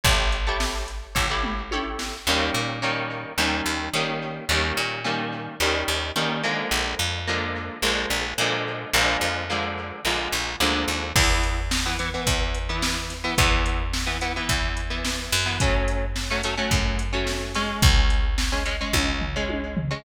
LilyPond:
<<
  \new Staff \with { instrumentName = "Overdriven Guitar" } { \time 4/4 \key a \major \tempo 4 = 108 <e' g' a' cis''>8. <e' g' a' cis''>4~ <e' g' a' cis''>16 <e' g' a' cis''>16 <e' g' a' cis''>8. <e' g' a' cis''>4 | \key bes \major <ees g bes des'>4 <ees g bes des'>4 <ees g bes des'>4 <ees g bes des'>4 | <ees g bes des'>4 <ees g bes des'>4 <ees g bes des'>4 <ees g bes des'>8 <d f aes bes>8~ | <d f aes bes>4 <d f aes bes>4 <d f aes bes>4 <d f aes bes>4 |
<d f aes bes>4 <d f aes bes>4 <d f aes bes>4 <d f aes bes>4 | \key a \major <e b>4~ <e b>16 <e b>16 <e b>16 <e b>4 <e b>4 <e b>16 | <e b>4~ <e b>16 <e b>16 <e b>16 <e b>4 <e b>4 <e b>16 | <fis a cis'>4~ <fis a cis'>16 <fis a cis'>16 <fis a cis'>16 <fis a cis'>4 <fis a cis'>8. <gis cis'>8~ |
<gis cis'>4~ <gis cis'>16 <gis cis'>16 <gis cis'>16 <gis cis'>4 <gis cis'>4 <gis cis'>16 | }
  \new Staff \with { instrumentName = "Electric Bass (finger)" } { \clef bass \time 4/4 \key a \major a,,2 a,,2 | \key bes \major ees,8 bes,4. ees,8 ees,8 ees4 | ees,8 bes,4. ees,8 ees,8 ees4 | bes,,8 f,4. bes,,8 bes,,8 bes,4 |
bes,,8 f,4. bes,,8 bes,,8 d,8 ees,8 | \key a \major e,2 e,2 | e,2 e,4. fis,8~ | fis,2 fis,2 |
cis,2 cis,2 | }
  \new DrumStaff \with { instrumentName = "Drums" } \drummode { \time 4/4 <hh bd>8 hh8 sn8 hh8 <bd tomfh>8 toml8 tommh8 sn8 | r4 r4 r4 r4 | r4 r4 r4 r4 | r4 r4 r4 r4 |
r4 r4 r4 r4 | <cymc bd>8 hh8 sn8 hh8 <hh bd>8 hh8 sn8 <hh sn>8 | <hh bd>8 hh8 sn8 hh8 <hh bd>8 hh8 sn8 <hho sn>8 | <hh bd>8 hh8 sn8 hh8 <hh bd>8 hh8 sn8 <hh sn>8 |
<hh bd>8 hh8 sn8 hh8 <bd tommh>8 tomfh8 tommh8 tomfh8 | }
>>